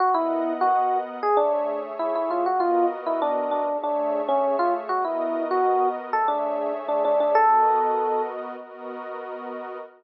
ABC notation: X:1
M:4/4
L:1/16
Q:1/4=98
K:Bmix
V:1 name="Electric Piano 1"
F E3 F3 z G =D3 z E E ^E | F =F2 z E =D2 D2 D3 C2 ^E z | F E3 F3 z A =D3 z D D D | A6 z10 |]
V:2 name="Pad 5 (bowed)"
[B,^Adf]8 [=A,Gce]8 | [B,F^Ad]8 [=A,Gce]8 | [B,F^Ad]8 [=A,Gce]8 | [B,F^Ad]8 [B,FAd]8 |]